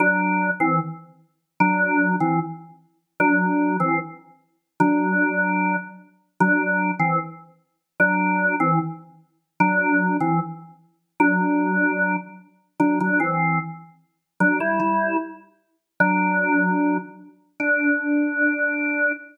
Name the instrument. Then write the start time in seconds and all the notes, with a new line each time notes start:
drawbar organ
0.00 F#3 D4
0.60 E3 C4
1.60 F#3 D4
2.20 E3 C4
3.20 F#3 D4
3.80 E3 C4
4.80 F#3 D4
6.40 F#3 D4
7.00 E3 C4
8.00 F#3 D4
8.60 E3 C4
9.60 F#3 D4
10.21 E3 C4
11.20 F#3 D4
12.80 F#3 D4
13.01 F#3 D4
13.20 E3 C4
14.40 F#3 D4
14.60 G3 E4
14.80 G3 E4
16.00 F#3 D4
17.60 D4